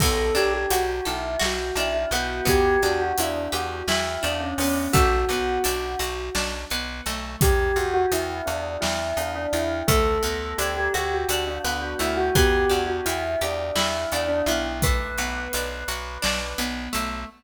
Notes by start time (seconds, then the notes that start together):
0.00 B1 B3 A4, kick, crash
0.35 B1 D4 G4, closed hi-hat
0.54 G4
0.70 B1 F#4, closed hi-hat
1.05 B1 E4 A4, closed hi-hat
1.39 B1 F#4, snare
1.75 B1 D4 E4, closed hi-hat
1.94 E4
2.11 B1 B3 F#4, closed hi-hat
2.45 E2 B3 G4, kick, closed hi-hat
2.82 E2 D4 F#4, closed hi-hat
3.01 F#4
3.18 E2 D4 E4, closed hi-hat
3.52 E2 F#4 G4, closed hi-hat
3.88 E2 E4, snare
4.23 E2 D4, closed hi-hat
4.40 C#4
4.58 E2 B3 C#4, open hi-hat
4.93 B1 A3 F#4, kick, closed hi-hat
5.29 B1 B3, closed hi-hat
5.64 B1 D4, closed hi-hat
5.99 B1 F#4, closed hi-hat
6.35 B1 D4, snare
6.70 B1 B3, closed hi-hat
7.06 B1 A3, closed hi-hat
7.41 E2 G4, kick, closed hi-hat
7.76 E2 F#4, closed hi-hat
7.94 F#4
8.12 E2 E4, closed hi-hat
8.46 E2 D4, closed hi-hat
8.81 E2 E4, snare
9.17 E2 D4, closed hi-hat
9.35 D4
9.53 E2 E4, closed hi-hat
9.87 D2 A3 A4, kick, closed hi-hat
10.23 D2 B3, closed hi-hat
10.58 D2 D4 G4, closed hi-hat
10.77 G4
10.94 D2 F#4 G4, closed hi-hat
11.14 F#4
11.29 D2 D4, closed hi-hat
11.47 D4
11.64 D2 B3 D4, closed hi-hat
11.82 F#4
11.99 D2 A3 E4, closed hi-hat
12.17 F#4
12.35 E2 B3 G4, kick, closed hi-hat
12.69 E2 D4 F#4, closed hi-hat
12.87 F#4
13.05 E2 E4, closed hi-hat
13.41 E2 D4 G4, closed hi-hat
13.75 E2 E4, snare
14.12 E2 D4, closed hi-hat
14.28 D4
14.46 B1 B3 E4, closed hi-hat
14.82 A3 B4, kick, closed hi-hat
15.18 B1 B3, closed hi-hat
15.53 B1 D4, closed hi-hat
15.88 B1 F#4, closed hi-hat
16.22 B1 D4, snare
16.58 B1 B3, closed hi-hat
16.93 B1 A3, closed hi-hat